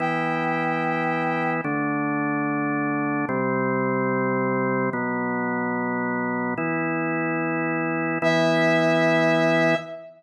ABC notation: X:1
M:4/4
L:1/8
Q:1/4=146
K:Em
V:1 name="Brass Section"
g8 | z8 | z8 | z8 |
z8 | e8 |]
V:2 name="Drawbar Organ"
[E,B,E]8 | [D,A,D]8 | [C,G,C]8 | [B,,F,B,]8 |
[E,B,E]8 | [E,B,E]8 |]